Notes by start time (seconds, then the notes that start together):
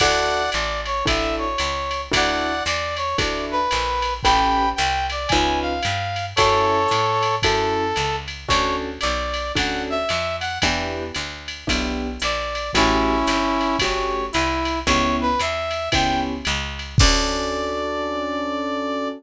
0.00 D2 D4 E4 F#4 A4 D5 F#5, kick, crash, ride
0.52 A1 D5, hi-hat pedal, ride
0.86 C#5, ride
1.06 A1 D4 E4 F#4 A4 E5, kick, ride
1.38 C#5
1.58 C#2, hi-hat pedal, ride
1.91 ride
2.12 D2 D4 E4 F#4 A4 D5 F#5, kick, ride
2.65 E2 D5, hi-hat pedal, ride
2.96 C#5, ride
3.18 D2 D4 E4 F#4 A4 D5, kick, ride
3.51 B4
3.71 A#1, hi-hat pedal, ride
4.02 ride
4.23 A1 C#4 G4 A4 B4 G5 B5, kick, ride
4.76 C2 G5, hi-hat pedal, ride
5.10 D5, ride
5.28 C#2 G#5, kick, ride
5.33 C#4 D#4 F4 B4
5.61 F5
5.83 G2, hi-hat pedal, ride
6.16 ride
6.36 F#2 C#4 E4 F#4 A4 C#5, kick, ride
6.88 A2, hi-hat pedal, ride
7.23 ride
7.42 F#2 C#4 E4 F#4 A4, kick, ride
7.96 C#2, hi-hat pedal, ride
8.28 ride
8.48 D2 C#4 D4 F#4 A4 C#5, kick, ride
9.01 B1 D5, hi-hat pedal, ride
9.34 ride
9.55 D2 C#4 D4 F#4 A4 F#5, kick, ride
9.90 E5
10.09 F2, hi-hat pedal, ride
10.40 F#5, ride
10.62 E2 B3 D4 E4 G4, kick, ride
11.14 D2, hi-hat pedal, ride
11.48 ride
11.67 B1 B3 D4 E4 G4, kick, ride
12.20 A#1 D5, hi-hat pedal, ride
12.55 ride
12.73 A1 A3 C#4 E4 F#4 G4, kick, ride
13.27 G1, hi-hat pedal, ride
13.61 ride
13.79 G1 A3 C#4 F#4 G4 C#5, kick, ride
14.32 C2 E4, hi-hat pedal, ride
14.65 ride
14.86 C#2 B3 C#4 E4 G4 C#5, kick, ride
15.21 B4
15.39 E2 E5, hi-hat pedal, ride
15.71 ride
15.92 C#2 B3 C#4 E4 G4 G5, kick, ride
16.45 C#2, hi-hat pedal, ride
16.79 ride
16.98 D2 C#4 D4 F#4 A4 D5, kick, crash